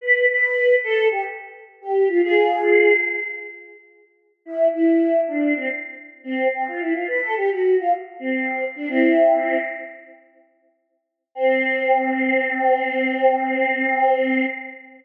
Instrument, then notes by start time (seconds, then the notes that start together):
choir aahs
0.01 B4
0.28 B4
0.83 A4
1.11 G4
1.81 G4
2.08 F4
2.23 F4 G#4
4.45 E4
4.73 E4
5.27 D4
5.56 C4
6.24 C4
6.53 C4
6.67 F4
6.80 E4
6.94 F4
7.07 B4
7.21 A4
7.36 G4
7.50 F#4
7.80 F4
8.19 C4
8.75 D4
8.88 C4 E4
11.35 C4